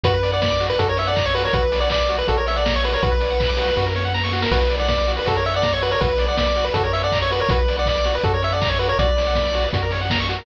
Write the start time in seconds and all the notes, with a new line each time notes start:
0.03 F#2 F#4 B4, kick, closed hi-hat
0.14 B4
0.23 D5, open hi-hat
0.32 D5 F#5
0.42 D5 B5, kick, snare
0.51 D6
0.60 F#4, open hi-hat
0.70 B4
0.79 F#2 F#4 A4, kick, closed hi-hat
0.88 A#4 C#5
0.97 C#5 E5, open hi-hat
1.07 D5 F#5
1.16 A#5, kick, clap
1.25 C#5 C#6
1.34 F#4 B4, open hi-hat
1.44 A#4 C#5
1.53 B1 F#4 B4, kick, closed hi-hat
1.63 B4
1.72 D5, open hi-hat
1.80 D5 F#5
1.90 D5 B5, kick, clap
2.00 D6
2.09 F#4, open hi-hat
2.18 B4
2.28 A#1 F#4 A4, kick, closed hi-hat
2.37 A#4 C#5
2.47 C#5 E5, open hi-hat
2.56 D5 F#5
2.65 A#5, kick, snare
2.75 C#5 C#6
2.84 F#4 B4, open hi-hat
2.93 A#4 C#5
3.02 B1 F#4 B4, kick, closed hi-hat
3.12 B4
3.20 D5, open hi-hat
3.30 F#5
3.40 B5, kick, clap
3.49 D6
3.57 F#4, open hi-hat
3.68 B4
3.76 F#2 F#4, kick, snare
3.86 A#4
3.95 C#5, snare
4.05 F#5
4.14 A#5, snare
4.24 C#6, snare
4.32 F#4, snare
4.42 A#4, snare
4.51 B1 F#4 B4, kick, crash
4.61 B4
4.70 D5, open hi-hat
4.79 D5 F#5
4.88 D5 B5, kick, snare
4.98 D6
5.07 F#4, open hi-hat
5.17 B4
5.26 F#2 F#4 A4, kick, closed hi-hat
5.35 A#4 C#5
5.45 C#5 E5, open hi-hat
5.54 D5 F#5
5.62 A#5, kick, snare
5.73 C#5 C#6
5.82 F#4 B4, open hi-hat
5.91 A#4 C#5
6.01 B1 F#4 B4, kick, closed hi-hat
6.10 B4
6.18 D5, open hi-hat
6.28 D5 F#5
6.37 D5 B5, kick, snare
6.47 D6
6.56 F#4, open hi-hat
6.64 B4
6.74 F#2 F#4 A4, kick, closed hi-hat
6.83 A#4 C#5
6.93 C#5 E5, open hi-hat
7.03 D5 F#5
7.12 A#5, kick, clap
7.22 C#5 C#6
7.30 F#4 B4, open hi-hat
7.40 A#4 C#5
7.49 B1 F#4 B4, kick, closed hi-hat
7.59 B4
7.68 D5, open hi-hat
7.78 D5 F#5
7.86 D5 B5, kick, clap
7.96 D6
8.04 F#4, open hi-hat
8.15 B4
8.24 F#2 F#4 A4, kick, closed hi-hat
8.34 A#4 C#5
8.42 C#5 E5, open hi-hat
8.52 D5 F#5
8.61 A#5, kick, clap
8.69 C#5 C#6
8.79 F#4 B4, open hi-hat
8.89 A#4 C#5
8.99 B1 F#4 D5, kick, closed hi-hat
9.08 B4
9.17 D5, open hi-hat
9.27 F#5
9.35 B5, kick, snare
9.45 D6
9.53 F#4, open hi-hat
9.64 B4
9.73 F#2 F#4, kick, closed hi-hat
9.83 A#4
9.91 C#5, open hi-hat
10.01 F#5
10.10 A#5, kick, snare
10.20 C#6
10.29 F#4, open hi-hat
10.39 A#4